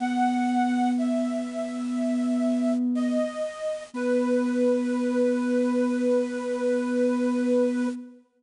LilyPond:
<<
  \new Staff \with { instrumentName = "Ocarina" } { \time 4/4 \key b \major \tempo 4 = 61 fis''4 e''2 dis''4 | b'1 | }
  \new Staff \with { instrumentName = "Ocarina" } { \time 4/4 \key b \major b1 | b1 | }
>>